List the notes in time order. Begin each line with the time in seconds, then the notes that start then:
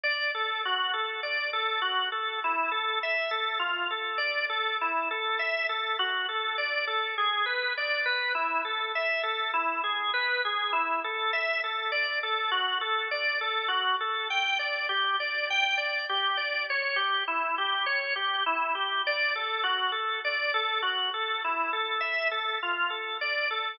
0.04 D5
0.35 A4
0.65 F#4
0.93 A4
1.23 D5
1.53 A4
1.82 F#4
2.12 A4
2.44 E4
2.72 A4
3.03 E5
3.31 A4
3.59 F4
3.91 A4
4.18 D5
4.50 A4
4.81 E4
5.11 A4
5.39 E5
5.69 A4
5.99 F#4
6.29 A4
6.58 D5
6.87 A4
7.18 G#4
7.46 B4
7.77 D5
8.06 B4
8.35 E4
8.65 A4
8.95 E5
9.23 A4
9.54 E4
9.84 G#4
10.14 B4
10.45 G#4
10.73 E4
11.04 A4
11.33 E5
11.64 A4
11.92 D5
12.23 A4
12.51 F#4
12.81 A4
13.11 D5
13.41 A4
13.68 F#4
14.00 A4
14.30 G5
14.59 D5
14.89 G4
15.20 D5
15.50 G5
15.77 D5
16.09 G4
16.37 D5
16.70 C#5
16.96 G4
17.28 E4
17.58 G4
17.86 C#5
18.16 G4
18.46 E4
18.75 G4
19.07 D5
19.36 A4
19.64 F#4
19.92 A4
20.25 D5
20.54 A4
20.82 F#4
21.14 A4
21.44 E4
21.73 A4
22.01 E5
22.31 A4
22.63 F4
22.90 A4
23.21 D5
23.51 A4